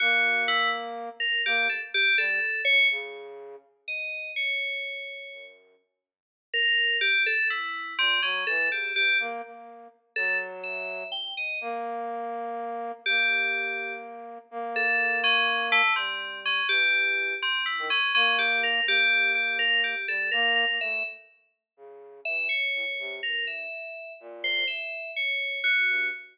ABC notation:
X:1
M:6/8
L:1/16
Q:3/8=83
K:none
V:1 name="Flute"
^A,10 z2 | ^A,2 z4 G,2 z2 ^F,2 | ^C,6 z6 | z8 ^F,,4 |
z12 | z6 ^A,,2 ^F,2 E,2 | ^C,2 E,2 ^A,2 A,4 z2 | ^F,8 z4 |
^A,12 | ^A,12 | ^A,12 | G,6 E,6 |
z3 ^D, z2 ^A,6 | ^A,10 G,2 | ^A,3 A, =A,2 z6 | ^C,4 E,2 z2 A,, ^F,, =C,2 |
G,,4 z4 ^A,,4 | z10 G,,2 |]
V:2 name="Electric Piano 2"
^F4 E2 z4 ^A2 | G2 A z G2 A4 ^c2 | z8 ^d4 | ^c10 z2 |
z6 ^A4 G2 | A2 E4 C2 ^C2 A2 | G2 G2 z8 | A2 z2 e4 g2 ^d2 |
z12 | G8 z4 | z2 A4 ^C4 A,2 | C4 ^C2 G6 |
C2 E2 ^C2 C2 G2 ^A2 | G4 G2 ^A2 G2 =A2 | ^A2 A2 e2 z6 | z4 e2 ^c6 |
^A2 e6 z2 c2 | e4 ^c4 ^F4 |]